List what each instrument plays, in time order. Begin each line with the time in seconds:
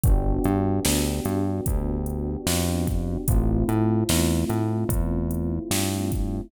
0.04 synth bass 1 G1, electric piano 1 B3 D4 F#4 G4, kick, closed hi-hat
0.44 synth bass 1 G2, closed hi-hat
0.85 synth bass 1 D2, snare
1.25 synth bass 1 G2, closed hi-hat
1.66 synth bass 1 D2, kick, closed hi-hat
2.06 closed hi-hat
2.47 synth bass 1 F2, snare
2.87 kick, closed hi-hat
3.28 synth bass 1 A1, electric piano 1 A3 C4 E4 F4, kick, closed hi-hat
3.69 synth bass 1 A2, closed hi-hat
4.09 synth bass 1 E2, snare
4.49 synth bass 1 A2, closed hi-hat
4.89 synth bass 1 E2, kick, closed hi-hat
5.31 closed hi-hat
5.71 synth bass 1 G2, snare
6.12 kick, closed hi-hat